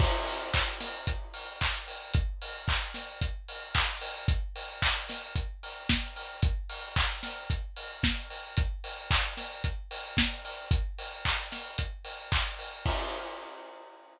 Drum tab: CC |x-------|--------|--------|--------|
HH |-o-oxo-o|xo-oxo-o|xo-oxo-o|xo-oxo-o|
CP |--x---x-|--x---x-|--x-----|--x-----|
SD |---o----|---o----|---o--o-|---o--o-|
BD |o-o-o-o-|o-o-o-o-|o-o-o-o-|o-o-o-o-|

CC |--------|--------|x-------|
HH |xo-oxo-o|xo-oxo-o|--------|
CP |--x-----|--x---x-|--------|
SD |---o--o-|---o----|--------|
BD |o-o-o-o-|o-o-o-o-|o-------|